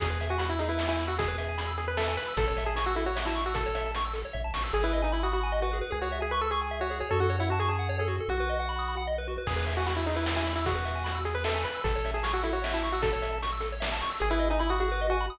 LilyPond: <<
  \new Staff \with { instrumentName = "Lead 1 (square)" } { \time 3/4 \key e \major \tempo 4 = 152 gis'8. fis'16 fis'16 e'16 dis'16 e'8 e'8 fis'16 | gis'4. gis'16 b'16 a'8 b'8 | a'8. gis'16 gis'16 fis'16 e'16 fis'8 e'8 fis'16 | a'4 r2 |
gis'16 e'8 dis'16 e'16 fis'16 fis'8. fis'8 r16 | gis'16 fis'8 gis'16 b'16 a'16 gis'8. fis'8 gis'16 | a'16 fis'8 e'16 fis'16 gis'16 gis'8. gis'8 r16 | fis'2 r4 |
gis'8. fis'16 fis'16 e'16 dis'16 e'8 e'8 e'16 | fis'4. gis'16 b'16 a'8 b'8 | a'8. gis'16 gis'16 fis'16 e'16 fis'8 e'8 fis'16 | a'4 r2 |
gis'16 e'8 dis'16 e'16 fis'16 fis'8. fis'8 r16 | }
  \new Staff \with { instrumentName = "Lead 1 (square)" } { \time 3/4 \key e \major gis'16 b'16 e''16 gis''16 b''16 e'''16 gis'16 b'16 e''16 gis''16 b''16 e'''16 | gis'16 b'16 e''16 gis''16 b''16 e'''16 gis'16 b'16 e''16 gis''16 b''16 e'''16 | a'16 cis''16 e''16 a''16 cis'''16 e'''16 a'16 cis''16 e''16 a''16 cis'''16 e'''16 | a'16 cis''16 e''16 a''16 cis'''16 e'''16 a'16 cis''16 e''16 a''16 cis'''16 e'''16 |
gis'16 b'16 dis''16 gis''16 b''16 dis'''16 b''16 gis''16 dis''16 b'16 gis'16 b'16 | gis'16 cis''16 e''16 gis''16 cis'''16 e'''16 cis'''16 gis''16 e''16 cis''16 gis'16 cis''16 | fis'16 a'16 cis''16 fis''16 a''16 cis'''16 a''16 fis''16 cis''16 a'16 fis'16 a'16 | fis'16 b'16 dis''16 fis''16 b''16 dis'''16 b''16 fis''16 dis''16 b'16 fis'16 b'16 |
gis'16 b'16 e''16 gis''16 b''16 e'''16 gis'16 b'16 e''16 gis''16 b''16 e'''16 | gis'16 b'16 e''16 gis''16 b''16 e'''16 gis'16 b'16 e''16 gis''16 b''16 e'''16 | a'16 cis''16 e''16 a''16 cis'''16 e'''16 a'16 cis''16 e''16 a''16 cis'''16 e'''16 | a'16 cis''16 e''16 a''16 cis'''16 e'''16 a'16 cis''16 e''16 a''16 cis'''16 e'''16 |
gis'16 b'16 dis''16 gis''16 b''16 dis'''16 gis'16 b'16 dis''16 gis''16 b''16 dis'''16 | }
  \new Staff \with { instrumentName = "Synth Bass 1" } { \clef bass \time 3/4 \key e \major e,2.~ | e,2. | a,,2.~ | a,,2 ais,,8 a,,8 |
gis,,2. | cis,2. | fis,2. | b,,2. |
e,2.~ | e,2. | a,,2.~ | a,,2. |
gis,,2. | }
  \new DrumStaff \with { instrumentName = "Drums" } \drummode { \time 3/4 <hh bd>8 hh8 hh8 hh8 sn8 hh8 | <hh bd>8 hh8 hh8 hh8 sn8 hh8 | <hh bd>8 hh8 hh8 hh8 sn8 hh8 | <hh bd>8 hh8 hh8 hh8 bd8 sn8 |
r4 r4 r4 | r4 r4 r4 | r4 r4 r4 | r4 r4 r4 |
<cymc bd>8 hh8 hh8 hh8 sn8 hh8 | <hh bd>8 hh8 hh8 hh8 sn8 hh8 | <hh bd>8 hh8 hh8 hh8 sn8 hh8 | <hh bd>8 hh8 hh8 hh8 sn8 hh8 |
r4 r4 r4 | }
>>